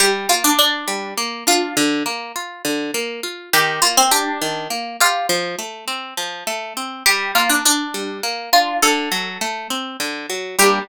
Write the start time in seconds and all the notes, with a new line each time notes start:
0.00 G3 G4
0.29 A#3 F4
0.44 D4
0.59 D4
0.88 G3
1.18 A#3
1.47 D4 F4
1.77 D3
2.06 A#3
2.36 F4
2.65 D3
2.94 A#3
3.23 F4
3.53 D#3 G4
3.82 A#3 F4
3.97 C4
4.11 D4 G4
4.42 D#3
4.70 A#3
5.00 F4 G4
5.29 F3
5.59 A3
5.88 C4
6.17 F3
6.47 A3
6.77 C4
7.06 G3 G4
7.35 A#3 F4
7.50 D4
7.65 D4
7.94 G3
8.23 A#3
8.53 D4 F4
8.82 D3 A4
9.12 F#3
9.41 A3
9.70 C4
10.00 D3
10.30 F#3
10.59 G3 A#3 G4
10.63 D4